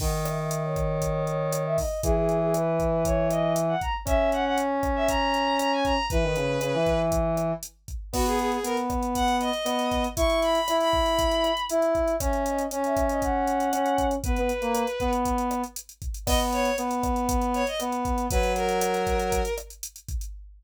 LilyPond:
<<
  \new Staff \with { instrumentName = "Violin" } { \time 4/4 \key b \major \tempo 4 = 118 fis''16 r16 e''16 e''8 cis''4~ cis''16 cis''8. e''16 dis''8 | gis'16 gis'8 gis'16 b'4 cis''8 dis''8 r16 fis''16 ais''16 r16 | e''8 fis''16 fis''16 r8. e''16 ais''4 ais''16 gis''16 ais''8 | b'2 r2 |
fis'16 gis'16 gis'16 gis'16 ais'16 r8. fis''8 dis''4. | cis'''8 b''8. b''4.~ b''16 r4 | e''8 dis''8 r16 e''8 dis''16 fis''2 | b'2 r2 |
dis''16 r16 cis''8 r4. cis''16 dis''16 r4 | b'8 ais'2 r4. | }
  \new Staff \with { instrumentName = "Brass Section" } { \time 4/4 \key b \major dis1 | e1 | cis'1 | e16 dis16 cis8 cis16 e4.~ e16 r4 |
b4 b2 b4 | e'4 e'2 e'4 | cis'4 cis'2 cis'4 | b16 b16 r16 ais8 r16 b4. r4 |
b4 b2 b4 | fis2~ fis8 r4. | }
  \new DrumStaff \with { instrumentName = "Drums" } \drummode { \time 4/4 <cymc bd>8 <hh ss>8 hh8 <hh bd ss>8 <hh bd>8 hh8 <hh ss>8 <hho bd>8 | <hh bd>8 hh8 <hh ss>8 <hh bd>8 <hh bd>8 <hh ss>8 hh8 <hh bd>8 | <hh bd ss>8 hh8 hh8 <hh bd ss>8 <hh bd>8 hh8 <hh ss>8 <hh bd>8 | <hh bd>8 hh8 <hh ss>8 <hh bd>8 <hh bd>8 <hh ss>8 hh8 <hh bd>8 |
<cymc bd ss>16 hh16 hh16 hh16 hh16 hh16 <hh bd ss>16 hh16 <hh bd>16 hh16 hh16 hh16 <hh ss>16 hh16 <hh bd>16 hh16 | <hh bd>16 hh16 hh16 hh16 <hh ss>16 hh16 bd16 hh16 <hh bd>16 hh16 <hh ss>16 hh16 hh16 hh16 <hh bd>16 hh16 | <hh bd ss>16 hh16 hh16 hh16 hh16 hh16 <hh bd ss>16 hh16 <hh bd>8 hh16 hh16 <hh ss>16 hh16 <hh bd>16 hh16 | <hh bd>16 hh16 hh16 hh16 <hh ss>16 hh16 <hh bd>16 hh16 <hh bd>16 hh16 <hh ss>16 hh16 hh16 hh16 <hh bd>16 hh16 |
<cymc bd ss>16 hh16 hh16 hh16 hh16 hh16 <hh bd ss>16 hh16 <hh bd>16 hh16 hh16 hh16 <hh ss>16 hh16 <hh bd>16 hh16 | <hh bd>16 hh16 hh16 hh16 <hh ss>16 hh16 <hh bd>16 hh16 <hh bd>16 hh16 <hh ss>16 hh16 hh16 hh16 <hh bd>16 hh16 | }
>>